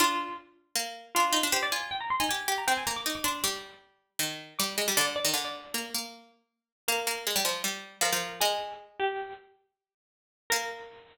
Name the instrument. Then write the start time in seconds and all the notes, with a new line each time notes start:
harpsichord
0.00 D4 F4
0.75 A#3
1.15 D4 F4
1.33 D#4
1.43 D4
1.52 G4 C5
1.63 D5
1.72 F4 G#5
1.91 G5
2.00 A#5
2.10 C6
2.20 D#4 G#5
2.29 G4 G#5
2.48 G4
2.58 A#5
2.68 C4 G5
2.77 G#5
2.87 A#3 A#5
2.96 D6
3.06 D#4 D6
3.15 D6
3.24 D4 C6
3.44 G3 D6
4.19 D#3
4.59 G3 D6
4.78 G#3
4.88 G3
4.97 D3 D5
5.16 D5
5.25 D#3
5.34 D3
5.45 D5
5.74 A#3
5.95 A#3
6.88 A#3 A#4
7.07 A#3
7.27 G#3
7.36 G3
7.45 F3
7.64 G3
8.01 F3 A#4
8.13 F3
8.41 G#3 G#4
9.00 G4
10.50 A#3 A#4